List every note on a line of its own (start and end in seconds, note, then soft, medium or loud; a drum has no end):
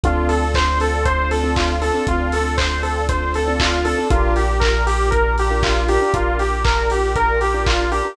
0.03 1.91 D2 loud
0.03 0.44 C4 medium
0.03 4.08 C4 loud
0.03 0.44 D4 loud
0.03 4.08 D4 loud
0.03 0.44 F4 loud
0.03 0.28 F4 medium
0.03 4.08 F4 loud
0.03 0.44 A4 loud
0.03 4.08 A4 medium
0.03 kick loud
0.03 closed hi-hat loud
0.29 0.52 A4 medium
0.29 open hi-hat medium
0.54 0.78 C5 loud
0.54 kick medium
0.54 clap loud
0.80 1.04 A4 medium
0.80 open hi-hat medium
1.05 1.29 C5 loud
1.05 kick loud
1.05 closed hi-hat loud
1.31 1.54 A4 medium
1.31 open hi-hat medium
1.43 1.74 C4 medium
1.43 1.74 D4 medium
1.43 1.74 F4 loud
1.43 1.74 A4 medium
1.56 1.80 F4 medium
1.56 kick loud
1.56 clap loud
1.81 1.92 C4 medium
1.81 1.92 D4 medium
1.81 1.92 F4 medium
1.81 2.05 A4 medium
1.81 1.92 A4 medium
1.81 open hi-hat medium
1.94 2.35 C4 loud
1.94 2.35 D4 medium
1.94 2.35 F4 medium
1.94 2.35 A4 medium
2.07 3.94 D2 medium
2.07 2.32 F4 medium
2.07 kick loud
2.07 closed hi-hat loud
2.32 2.56 A4 medium
2.32 open hi-hat loud
2.57 2.81 C5 loud
2.57 kick medium
2.57 clap loud
2.83 3.06 A4 medium
2.83 open hi-hat medium
3.09 3.32 C5 medium
3.09 kick loud
3.09 closed hi-hat loud
3.34 3.58 A4 medium
3.34 open hi-hat medium
3.47 3.77 C4 medium
3.47 3.77 D4 medium
3.47 3.77 F4 medium
3.47 3.77 A4 medium
3.60 3.84 F4 medium
3.60 kick loud
3.60 clap loud
3.85 3.95 C4 medium
3.85 3.95 D4 medium
3.85 3.95 F4 medium
3.85 4.08 A4 medium
3.85 3.95 A4 medium
3.85 open hi-hat loud
3.98 4.08 C4 medium
3.98 4.08 D4 medium
3.98 4.08 F4 medium
3.98 4.08 A4 medium
4.10 5.98 A#1 loud
4.10 8.13 D4 medium
4.10 4.51 D4 loud
4.10 8.13 F4 medium
4.10 4.34 F4 loud
4.10 4.51 F4 loud
4.10 8.13 G4 loud
4.10 4.51 G4 loud
4.10 8.13 A#4 loud
4.10 4.51 A#4 medium
4.10 kick loud
4.10 closed hi-hat loud
4.36 4.60 G4 medium
4.36 open hi-hat medium
4.60 4.83 A#4 medium
4.60 kick loud
4.60 clap loud
4.87 5.10 G4 medium
4.87 open hi-hat loud
5.11 5.34 A#4 medium
5.11 kick loud
5.11 closed hi-hat loud
5.38 5.63 G4 medium
5.38 open hi-hat medium
5.50 5.81 D4 medium
5.50 5.81 F4 medium
5.50 5.81 G4 medium
5.50 5.81 A#4 medium
5.63 5.87 F4 loud
5.63 kick loud
5.63 clap loud
5.88 5.99 D4 medium
5.88 5.99 F4 medium
5.88 5.99 G4 loud
5.88 6.12 G4 medium
5.88 5.99 A#4 medium
5.88 open hi-hat medium
6.01 6.42 D4 loud
6.01 6.42 F4 medium
6.01 6.42 G4 medium
6.01 6.42 A#4 medium
6.14 8.01 A#1 medium
6.14 6.38 F4 medium
6.14 kick loud
6.14 closed hi-hat loud
6.39 6.63 G4 medium
6.39 open hi-hat medium
6.64 6.88 A#4 medium
6.64 kick loud
6.64 clap loud
6.90 7.15 G4 medium
6.90 open hi-hat medium
7.16 7.39 A#4 loud
7.16 kick loud
7.16 closed hi-hat loud
7.41 7.64 G4 medium
7.41 open hi-hat medium
7.54 7.84 D4 medium
7.54 7.84 F4 medium
7.54 7.84 G4 medium
7.54 7.84 A#4 medium
7.66 7.90 F4 medium
7.66 kick loud
7.66 clap loud
7.91 8.01 D4 medium
7.91 8.01 F4 medium
7.91 8.01 G4 medium
7.91 8.15 G4 medium
7.91 8.01 A#4 medium
7.91 open hi-hat medium
8.05 8.15 D4 medium
8.05 8.15 F4 medium
8.05 8.15 G4 medium
8.05 8.15 A#4 loud